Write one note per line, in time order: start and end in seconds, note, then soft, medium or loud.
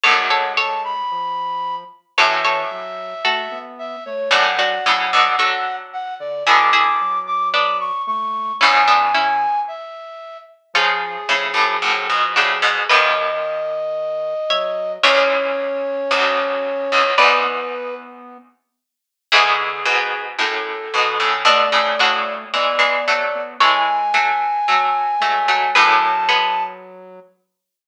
0.03 1.48 D2 medium
0.03 1.48 F#2 medium
0.03 0.94 G#3 loud
0.03 0.26 A4 medium
0.03 0.26 C#5 medium
0.03 0.52 F#5 medium
0.30 0.53 A4 medium
0.30 0.53 C#5 medium
0.57 1.54 A4 medium
0.57 1.54 C#5 medium
0.57 0.81 A5 medium
0.84 1.75 B5 medium
1.11 1.84 F3 loud
2.17 4.25 F#2 medium
2.17 4.25 A2 medium
2.17 2.64 E3 loud
2.17 2.41 A4 medium
2.17 2.41 C#5 medium
2.17 3.58 E5 loud
2.44 3.14 A4 medium
2.44 3.14 C#5 medium
2.71 3.14 F#3 loud
3.25 3.48 A3 medium
3.25 4.11 F#4 medium
3.25 4.11 A4 medium
3.51 3.96 B3 loud
3.79 4.04 E5 medium
4.05 4.30 A3 medium
4.05 4.29 C#5 medium
4.31 4.74 F#2 medium
4.31 4.74 A2 medium
4.31 4.55 F#3 loud
4.31 4.53 D4 medium
4.31 4.53 F#4 medium
4.31 5.76 F#5 loud
4.57 4.80 F#3 loud
4.57 5.27 D4 medium
4.57 5.27 F#4 medium
4.85 5.10 A2 medium
4.85 5.10 C#3 medium
4.85 5.28 F#3 loud
5.13 5.35 B2 medium
5.13 5.35 D3 medium
5.39 6.35 D3 medium
5.39 6.35 F#3 medium
5.39 6.37 F#4 medium
5.39 6.37 A4 medium
5.93 6.14 F#5 medium
6.20 6.43 D3 loud
6.20 6.44 D5 medium
6.47 8.21 B2 medium
6.47 8.21 D3 medium
6.47 6.92 D3 loud
6.47 6.70 E4 medium
6.47 6.70 G#4 medium
6.47 7.19 D6 medium
6.73 7.42 E4 medium
6.73 7.42 G#4 medium
7.01 7.91 F#3 medium
7.27 7.49 D6 medium
7.54 8.56 B3 medium
7.54 8.56 D4 medium
7.54 7.77 D6 medium
7.80 8.02 C#6 medium
8.07 8.52 A3 loud
8.07 8.53 C#6 medium
8.60 9.82 E2 medium
8.60 9.82 G#2 medium
8.60 9.47 C#3 loud
8.60 8.84 C#4 medium
8.60 8.84 E4 medium
8.60 9.59 G#5 medium
8.87 9.12 B3 medium
8.87 9.12 D4 medium
9.14 10.23 C#4 medium
9.14 10.23 E4 medium
9.68 10.37 E5 medium
10.74 11.23 C#3 medium
10.74 11.17 F3 loud
10.74 11.23 F3 medium
10.74 12.07 C#4 medium
10.74 12.07 F4 medium
10.74 12.05 G#4 loud
11.28 11.53 A2 medium
11.28 11.54 C#3 medium
11.28 12.77 F3 medium
11.54 11.77 F#2 medium
11.54 11.77 A2 medium
11.82 12.08 F#2 medium
11.82 12.08 A2 medium
12.09 12.35 G#2 medium
12.09 12.35 B2 medium
12.36 12.61 A2 medium
12.36 12.61 C#3 medium
12.36 12.85 D4 medium
12.36 12.85 F#4 medium
12.36 12.85 G#4 medium
12.62 12.84 G#2 medium
12.62 12.84 B2 medium
12.89 13.79 D#2 medium
12.89 13.79 F#2 medium
12.89 14.34 D#3 loud
12.89 14.37 B4 medium
12.89 14.92 D#5 medium
12.89 14.37 D#5 medium
14.49 14.98 F#3 loud
14.49 15.01 C#5 medium
14.49 15.01 E5 medium
15.03 16.02 C#2 medium
15.03 16.02 E2 medium
15.03 17.03 C#4 loud
15.03 16.92 C#5 medium
15.03 17.10 C#5 loud
15.03 16.92 E5 medium
16.11 16.87 B1 medium
16.11 16.87 D2 medium
16.92 17.14 C#2 medium
16.92 17.14 E2 medium
17.18 18.48 E2 medium
17.18 18.48 G#2 medium
17.18 17.41 B3 loud
17.18 17.94 B4 medium
17.18 18.95 B4 medium
17.18 18.95 D5 medium
17.45 18.37 B3 medium
19.32 19.84 E2 medium
19.32 19.84 G#2 medium
19.32 19.83 D3 loud
19.32 21.11 E4 medium
19.32 21.11 G#4 medium
19.32 20.22 G#4 loud
19.85 20.35 G#2 medium
19.85 20.35 B2 medium
20.38 20.91 F#2 medium
20.38 20.91 A2 medium
20.38 21.29 A4 medium
20.94 21.18 G#2 medium
20.94 21.18 B2 medium
20.94 21.45 D3 loud
21.20 21.42 A2 medium
21.20 21.42 C#3 medium
21.45 21.67 B2 medium
21.45 21.67 D3 medium
21.45 22.45 A3 loud
21.45 21.98 D4 medium
21.45 21.98 F#4 medium
21.45 22.33 D5 medium
21.72 21.94 A2 medium
21.72 21.94 C#3 medium
21.99 22.49 A2 medium
21.99 22.49 C#3 medium
21.99 23.21 D4 medium
21.99 23.21 F#4 medium
22.53 22.78 E3 medium
22.53 22.78 G#3 medium
22.53 23.20 B3 medium
22.53 23.42 D5 medium
22.79 23.02 E3 medium
22.79 23.02 G#3 medium
23.07 23.54 F#3 medium
23.07 23.54 A3 medium
23.35 23.57 B3 medium
23.60 24.10 E3 medium
23.60 24.10 G#3 medium
23.60 24.13 G#3 loud
23.60 25.67 A4 medium
23.60 25.67 C#5 medium
23.60 25.69 G#5 medium
24.14 24.59 F#3 medium
24.14 24.59 A3 medium
24.68 25.15 F#3 medium
24.68 25.15 A3 medium
25.20 25.48 F#3 medium
25.20 25.67 G#3 loud
25.20 25.48 A3 medium
25.48 25.71 F#3 medium
25.48 25.71 A3 medium
25.75 26.79 F#2 medium
25.75 26.79 A2 medium
25.75 27.20 F#3 loud
25.75 26.19 G#4 medium
25.75 26.19 B4 medium
25.75 26.63 A5 medium
26.29 27.61 G#3 medium
26.29 27.61 B3 medium